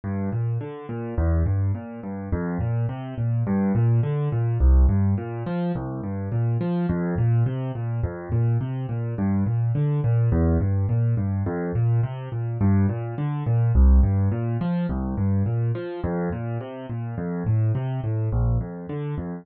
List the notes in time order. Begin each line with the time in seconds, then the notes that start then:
0.04 G2
0.32 A#2
0.61 D3
0.89 A#2
1.18 E2
1.46 G2
1.75 A#2
2.03 G2
2.32 F2
2.60 A#2
2.89 C3
3.18 A#2
3.47 G2
3.75 A#2
4.03 D3
4.32 A#2
4.60 C2
4.89 G2
5.18 A#2
5.46 F3
5.75 C2
6.03 G2
6.32 A#2
6.61 F3
6.89 F2
7.18 A#2
7.46 C3
7.75 A#2
8.03 F2
8.32 A#2
8.61 C3
8.89 A#2
9.18 G2
9.46 A#2
9.75 D3
10.04 A#2
10.32 E2
10.60 G2
10.89 A#2
11.17 G2
11.46 F2
11.75 A#2
12.03 C3
12.32 A#2
12.61 G2
12.89 A#2
13.18 D3
13.46 A#2
13.75 C2
14.03 G2
14.32 A#2
14.61 F3
14.89 C2
15.17 G2
15.46 A#2
15.75 F3
16.04 F2
16.32 A#2
16.61 C3
16.89 A#2
17.18 F2
17.46 A2
17.75 C3
18.04 A2
18.32 A#1
18.61 F2
18.89 D3
19.18 F2